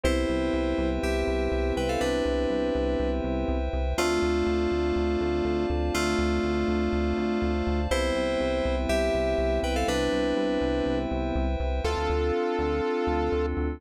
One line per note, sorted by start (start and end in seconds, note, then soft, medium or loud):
0.03 0.25 C2 medium
0.03 3.58 B3 medium
0.03 3.58 C4 medium
0.03 3.58 E4 medium
0.03 0.89 E4 medium
0.03 3.58 G4 medium
0.03 3.93 B4 medium
0.03 3.93 C5 medium
0.03 0.89 C5 medium
0.03 3.93 E5 medium
0.03 3.93 G5 medium
0.29 0.50 C2 medium
0.53 0.74 C2 medium
0.78 0.99 C2 medium
1.03 1.24 C2 medium
1.03 1.74 G4 medium
1.03 1.74 E5 medium
1.27 1.48 C2 medium
1.52 1.72 C2 medium
1.76 1.97 C2 medium
1.76 1.89 B4 medium
1.76 1.89 G5 medium
1.89 2.01 A4 medium
1.89 2.01 F5 medium
2.01 2.22 C2 medium
2.01 3.10 D4 medium
2.01 3.10 B4 medium
2.25 2.46 C2 medium
2.50 2.71 C2 medium
2.75 2.96 C2 medium
3.00 3.21 C2 medium
3.24 3.45 C2 medium
3.48 3.69 C2 medium
3.73 3.94 C2 medium
3.98 4.19 D2 medium
3.98 5.66 A3 medium
3.98 7.52 A3 medium
3.98 7.52 C4 medium
3.98 7.52 D4 medium
3.98 5.66 F4 loud
3.98 7.52 F4 medium
3.98 7.87 C5 medium
3.98 7.87 D5 medium
3.98 7.87 F5 medium
3.98 7.87 A5 medium
4.22 4.43 D2 medium
4.46 4.67 D2 medium
4.72 4.92 D2 medium
4.96 5.17 D2 medium
5.21 5.42 D2 medium
5.45 5.66 D2 medium
5.70 5.91 D2 medium
5.94 6.15 D2 medium
5.94 7.80 A3 medium
5.94 7.80 F4 loud
6.19 6.40 D2 medium
6.44 6.65 D2 medium
6.68 6.89 D2 medium
6.93 7.14 D2 medium
7.18 7.39 D2 medium
7.42 7.63 D2 medium
7.67 7.88 D2 medium
7.90 8.12 C2 loud
7.90 11.46 G3 medium
7.90 11.46 B3 medium
7.90 11.46 C4 medium
7.90 8.75 E4 medium
7.90 11.46 E4 medium
7.90 11.80 B4 medium
7.90 11.80 C5 medium
7.90 8.75 C5 medium
7.90 11.80 E5 medium
7.90 11.80 G5 medium
8.16 8.37 C2 medium
8.40 8.61 C2 medium
8.65 8.86 C2 medium
8.89 9.10 C2 medium
8.89 9.60 G4 medium
8.89 9.60 E5 medium
9.14 9.35 C2 medium
9.38 9.59 C2 medium
9.63 9.84 C2 medium
9.63 9.75 B4 medium
9.63 9.75 G5 medium
9.76 9.87 A4 medium
9.76 9.87 F5 medium
9.88 10.09 C2 medium
9.88 10.98 D4 medium
9.88 10.98 B4 medium
10.13 10.34 C2 medium
10.37 10.58 C2 medium
10.61 10.82 C2 medium
10.86 11.07 C2 medium
11.11 11.32 C2 medium
11.35 11.56 C2 medium
11.60 11.81 C2 medium
11.84 11.95 D2 medium
11.84 13.79 C4 medium
11.84 13.79 D4 medium
11.84 13.79 F4 medium
11.84 13.46 F4 medium
11.84 13.79 A4 medium
11.84 13.46 A4 loud
11.97 12.08 D2 medium
12.10 12.32 D2 medium
12.59 12.81 D2 medium
13.07 13.29 D2 medium
13.32 13.54 D2 medium
13.57 13.79 D2 medium